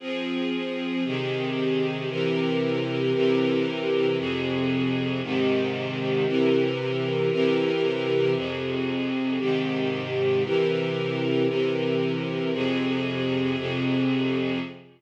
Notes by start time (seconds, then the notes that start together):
0.00 F3 C4 G#4
1.04 C3 D#3 G4 G#4
2.09 C3 E3 G4 A#4
3.13 C3 E3 G4 A#4
4.17 F2 C3 G#4
5.22 G#2 C3 D#3 G4
6.26 C3 E3 G4 A#4
7.31 C3 E3 G4 A#4
8.35 F2 C3 G#4
9.39 G#2 C3 D#3 G4
10.43 C3 E3 G4 A#4
11.48 C3 E3 G4 A#4
12.53 F2 C3 G#4
13.57 F2 C3 G#4